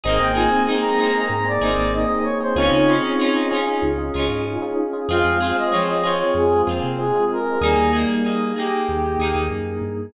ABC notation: X:1
M:4/4
L:1/16
Q:1/4=95
K:Ab
V:1 name="Lead 1 (square)"
e g a2 z b3 b =d3 e2 _d c | d d5 z10 | f2 f e d e d d A2 z2 A2 B2 | A2 z4 G6 z4 |]
V:2 name="Brass Section"
C2 F C A,4 C2 E2 E4 | [CE]8 z8 | A,2 C A, F,4 A,2 B,2 A,4 | [G,B,]6 z10 |]
V:3 name="Electric Piano 1"
[B,CEA] [B,CEA]2 [B,CEA]2 [B,CEA] [B,CEA] [B,CEA]2 [B,CEA] [B,CEA]2 [B,CEA] [B,CEA]2 [B,CEA] | [DEFA] [DEFA]2 [DEFA]2 [DEFA] [DEFA] [DEFA]2 [DEFA] [DEFA]2 [DEFA] [DEFA]2 [DEFA] | [CFA] [CFA]2 [CFA]2 [CFA] [CFA] [CFA]2 [CFA] [CFA]2 [CFA] [CFA]2 [CFA] | z16 |]
V:4 name="Acoustic Guitar (steel)"
[B,CEA]2 [B,CEA]2 [B,CEA]2 [B,CEA]4 [B,CEA]6 | [DEFA]2 [DEFA]2 [DEFA]2 [DEFA]4 [DEFA]6 | [CFA]2 [CFA]2 [CFA]2 [CFA]4 [CFA]6 | [B,EA]2 [B,EA]2 [B,EA]2 [B,EA]4 [B,EA]6 |]
V:5 name="Synth Bass 1" clef=bass
A,,, A,,,7 A,,2 A,,, A,,,5 | D,, D,7 D,,2 D,, A,,5 | F,, F,,7 F,,2 F,, C,5 | E,, E,,7 E,,2 E,, E,, _G,,2 =G,,2 |]
V:6 name="Pad 5 (bowed)"
[B,CEA]16 | [DEFA]16 | [CFA]16 | [B,EA]16 |]